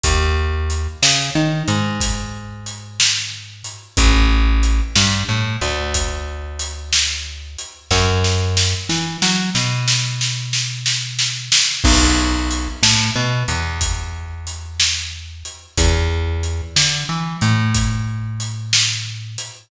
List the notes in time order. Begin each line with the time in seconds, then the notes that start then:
0.04 D#2, kick, closed hi-hat
0.70 closed hi-hat
1.02 C#3, snare
1.35 D#3
1.68 G#2, closed hi-hat
2.01 kick, closed hi-hat
2.66 closed hi-hat
3.00 snare
3.64 closed hi-hat
3.97 A1, kick, closed hi-hat
4.63 closed hi-hat
4.96 G2, snare
5.29 A2
5.61 D2, closed hi-hat
5.94 kick, closed hi-hat
6.59 closed hi-hat
6.93 snare
7.58 closed hi-hat
7.91 F#2, kick, snare
8.24 snare
8.57 snare
8.89 E3, snare
9.22 F#3, snare
9.55 B2, snare
9.88 snare
10.21 snare
10.53 snare
10.86 snare
11.19 snare
11.52 snare
11.84 B1, kick, crash
12.51 closed hi-hat
12.83 A2, snare
13.16 B2
13.48 E2, closed hi-hat
13.81 kick, closed hi-hat
14.47 closed hi-hat
14.80 snare
15.45 closed hi-hat
15.77 E2, kick, closed hi-hat
16.43 closed hi-hat
16.76 D3, snare
17.09 E3
17.41 A2, closed hi-hat
17.75 kick, closed hi-hat
18.40 closed hi-hat
18.73 snare
19.38 closed hi-hat